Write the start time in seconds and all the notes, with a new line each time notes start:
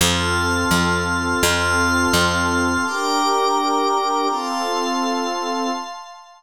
0.01 F2 C4 F4 A4 A5 C6 F6
0.71 F2
1.43 F2 C4 F4 A4 A5 C6 F6
2.13 F2
2.85 D4 G4 A#4 G5 A#5 D6
4.29 C4 F4 A4 F5 A5 C6